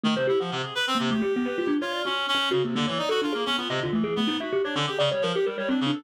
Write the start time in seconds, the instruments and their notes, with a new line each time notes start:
0.03 clarinet D#3, kalimba A3
0.16 clarinet C3, kalimba C5
0.27 clarinet E4, kalimba G4
0.40 clarinet F3, kalimba F#5
0.51 clarinet C3
0.64 clarinet G#4
0.75 clarinet B4
0.87 clarinet C4
0.95 kalimba A#3
0.99 clarinet C3
1.10 kalimba A3, clarinet G4
1.22 kalimba G4
1.36 kalimba B3
1.46 kalimba B4
1.58 kalimba F4
1.67 kalimba D4
1.81 clarinet F4, kalimba C#5
1.92 kalimba D5
2.05 clarinet C#4, kalimba F#4
2.28 clarinet C#4
2.35 kalimba C#4
2.51 clarinet C#3, kalimba F#4
2.64 clarinet C3, kalimba A#3
2.75 clarinet D3, kalimba A#3
2.87 clarinet E3, kalimba C#5
2.98 clarinet D#4, kalimba D5
3.09 clarinet F#4, kalimba A4
3.22 kalimba D4, clarinet F4
3.33 clarinet A#3, kalimba G#4
3.46 kalimba B3, clarinet C#4
3.57 clarinet B3, kalimba F4
3.69 clarinet C3, kalimba D#5
3.80 clarinet D3, kalimba F4
3.93 clarinet E3, kalimba A3
4.04 kalimba G#4
4.16 kalimba A3, clarinet B3
4.27 kalimba D#4
4.40 clarinet F#4, kalimba E5
4.52 kalimba G4
4.64 clarinet D4, kalimba C#5
4.75 clarinet D3, kalimba C#4
4.87 clarinet G4, kalimba G#4
4.99 clarinet C#3, kalimba D5
5.11 clarinet G3, kalimba C#5
5.22 clarinet F3, kalimba A#4
5.34 clarinet G4, kalimba G4
5.46 clarinet G3, kalimba A#4
5.58 clarinet G3, kalimba C#5
5.69 kalimba C4, clarinet D4
5.81 clarinet C#3
5.86 kalimba D4
5.93 clarinet A4